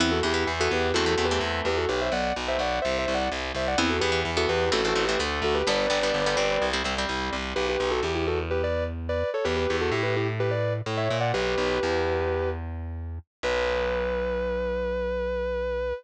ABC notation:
X:1
M:4/4
L:1/16
Q:1/4=127
K:Em
V:1 name="Distortion Guitar"
[CE] [FA] [EG]2 z [FA] [GB]2 (3[FA]2 [FA]2 [GB]2 z2 [GB] [FA] | [GB] [ce] [df]2 z [ce] [df]2 (3[ce]2 [ce]2 [df]2 z2 [ce] [df] | [CE] [FA] [GB]2 z [FA] [GB]2 (3[FA]2 [FA]2 [GB]2 z2 [FA] [GB] | [Bd]10 z6 |
[K:Bm] [GB] [GB]2 [FA] [EG] [EG] [FA] z [GB] [Bd]2 z2 [Bd]2 [Ac] | [GB] [GB]2 [FA] [EG] [GB] [EG] z [GB] [Bd]2 z2 [ce]2 [df] | "^rit." [GB]10 z6 | B16 |]
V:2 name="Overdriven Guitar"
[E,B,]2 [E,B,] [E,B,]2 [E,B,]3 [E,A,C] [E,A,C] [E,A,C] [E,A,C]5 | z16 | [E,B,]2 [E,B,] [E,B,]2 [E,B,]3 [E,A,C] [E,A,C] [E,A,C] [E,A,C] [D,A,]4 | [D,G,B,]2 [D,G,B,] [D,G,B,]2 [D,G,B,] [G,C]3 [G,C] [G,C] [G,C]5 |
[K:Bm] z16 | z16 | "^rit." z16 | z16 |]
V:3 name="Electric Bass (finger)" clef=bass
E,,2 E,,2 E,,2 E,,2 E,,2 E,,2 E,,2 E,,2 | B,,,2 B,,,2 B,,,2 B,,,2 C,,2 C,,2 C,,2 C,,2 | E,,2 E,,2 E,,2 E,,2 A,,,2 A,,,2 D,,2 D,,2 | G,,,2 G,,,2 G,,,2 G,,,2 C,,2 C,,2 C,,2 C,,2 |
[K:Bm] B,,,2 B,,,2 E,,12 | E,,2 E,,2 A,,8 A,,2 ^A,,2 | "^rit." B,,,2 B,,,2 E,,12 | B,,,16 |]